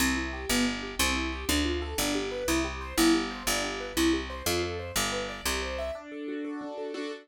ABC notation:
X:1
M:6/8
L:1/8
Q:3/8=121
K:C
V:1 name="Acoustic Grand Piano"
C E G B, D G | C E G D F A | D G B E G c | E G c D G B |
E G c F A c | G B d G c e | [K:D] D A F A D A | [DFA]3 z3 |]
V:2 name="Electric Bass (finger)" clef=bass
C,,3 G,,,3 | C,,3 D,,3 | G,,,3 C,,3 | G,,,3 G,,,3 |
C,,3 F,,3 | G,,,3 C,,3 | [K:D] z6 | z6 |]